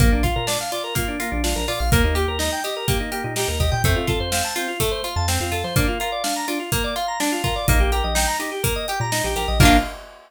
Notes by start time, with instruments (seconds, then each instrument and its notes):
0.00 synth bass 1 A#1, acoustic guitar (steel) A#3, drawbar organ A#3, kick, closed hi-hat
0.12 synth bass 1 A#1, drawbar organ D4
0.23 acoustic guitar (steel) F4, drawbar organ F4, kick, closed hi-hat
0.36 synth bass 1 A#2, drawbar organ A#4
0.47 acoustic guitar (steel) D4, drawbar organ D5, snare
0.61 drawbar organ F5
0.72 acoustic guitar (steel) F4, drawbar organ D5, closed hi-hat
0.84 drawbar organ A#4
0.95 acoustic guitar (steel) A#3, drawbar organ F4, kick, closed hi-hat
1.08 drawbar organ D4
1.20 drawbar organ A#3, acoustic guitar (steel) F4, closed hi-hat
1.32 synth bass 1 A#1, drawbar organ D4
1.44 acoustic guitar (steel) D4, drawbar organ F4, snare
1.56 synth bass 1 A#1, drawbar organ A#4
1.68 synth bass 1 A#2, acoustic guitar (steel) F4, drawbar organ D5, open hi-hat
1.79 synth bass 1 A#1, drawbar organ F5
1.92 synth bass 1 D#2, drawbar organ A#3, acoustic guitar (steel) A#3, kick, closed hi-hat
2.04 synth bass 1 D#2, drawbar organ D#4
2.15 acoustic guitar (steel) G4, drawbar organ G4, closed hi-hat
2.28 synth bass 1 D#2, drawbar organ A#4
2.39 acoustic guitar (steel) D#4, drawbar organ D#5, snare
2.52 drawbar organ G5
2.64 acoustic guitar (steel) G4, drawbar organ D#5, closed hi-hat
2.77 drawbar organ A#4
2.87 acoustic guitar (steel) A#3, drawbar organ G4, kick, closed hi-hat
3.00 drawbar organ D#4
3.12 drawbar organ A#3, acoustic guitar (steel) G4, closed hi-hat
3.24 synth bass 1 A#2, drawbar organ D#4
3.36 acoustic guitar (steel) D#4, drawbar organ G4, snare
3.48 synth bass 1 D#2, drawbar organ A#4
3.60 synth bass 1 D#2, acoustic guitar (steel) G4, drawbar organ D#5, kick, closed hi-hat
3.72 synth bass 1 A#2, drawbar organ G5
3.84 synth bass 1 F2, acoustic guitar (steel) A3, drawbar organ C4, kick, closed hi-hat
3.96 synth bass 1 F2, drawbar organ F4
4.07 acoustic guitar (steel) F4, drawbar organ A4, kick, closed hi-hat
4.20 synth bass 1 F2, drawbar organ C5
4.32 acoustic guitar (steel) C4, drawbar organ F5, snare
4.45 drawbar organ A5
4.56 drawbar organ C4, acoustic guitar (steel) F4, closed hi-hat
4.68 drawbar organ F4
4.80 acoustic guitar (steel) A3, drawbar organ A4, kick, closed hi-hat
4.91 drawbar organ C5
5.04 acoustic guitar (steel) F4, drawbar organ F5, closed hi-hat
5.16 synth bass 1 F2, drawbar organ A5
5.28 drawbar organ C4, acoustic guitar (steel) C4, snare
5.40 synth bass 1 F2, drawbar organ F4
5.52 synth bass 1 F2, acoustic guitar (steel) F4, drawbar organ A4, closed hi-hat
5.64 synth bass 1 F3, drawbar organ C5
5.76 acoustic guitar (steel) A#3, drawbar organ D4, kick, closed hi-hat
5.88 drawbar organ F4
6.00 acoustic guitar (steel) F4, drawbar organ A#4, closed hi-hat
6.12 drawbar organ D5
6.24 acoustic guitar (steel) D4, drawbar organ F5, snare
6.36 drawbar organ A#5
6.48 drawbar organ D4, acoustic guitar (steel) F4, closed hi-hat
6.59 drawbar organ F4
6.72 acoustic guitar (steel) A#3, drawbar organ A#4, kick, closed hi-hat
6.84 drawbar organ D5
6.96 acoustic guitar (steel) F4, drawbar organ F5, closed hi-hat
7.08 drawbar organ A#5
7.20 drawbar organ D4, acoustic guitar (steel) D4, snare
7.32 drawbar organ F4
7.44 acoustic guitar (steel) F4, drawbar organ A#4, kick, closed hi-hat
7.56 drawbar organ D5
7.68 synth bass 1 A#1, acoustic guitar (steel) A#3, drawbar organ D#4, kick, closed hi-hat
7.80 synth bass 1 A#1, drawbar organ G4
7.92 acoustic guitar (steel) G4, drawbar organ A#4, closed hi-hat
8.04 synth bass 1 A#1, drawbar organ D#5
8.15 acoustic guitar (steel) D#4, drawbar organ G5, snare
8.28 drawbar organ A#5
8.39 drawbar organ D#4, acoustic guitar (steel) G4, closed hi-hat
8.52 drawbar organ G4
8.63 acoustic guitar (steel) A#3, drawbar organ A#4, kick, closed hi-hat
8.76 drawbar organ D#5
8.88 acoustic guitar (steel) G4, drawbar organ G5, closed hi-hat
9.00 synth bass 1 A#2, drawbar organ A#5
9.12 acoustic guitar (steel) D#4, drawbar organ D#4, snare
9.24 synth bass 1 A#1, drawbar organ G4
9.36 synth bass 1 A#1, acoustic guitar (steel) G4, drawbar organ A#4, closed hi-hat
9.48 synth bass 1 A#1, drawbar organ D#5
9.60 synth bass 1 A#1, acoustic guitar (steel) A#3 D4, drawbar organ A#3 D4 F4, kick, crash
9.65 acoustic guitar (steel) F4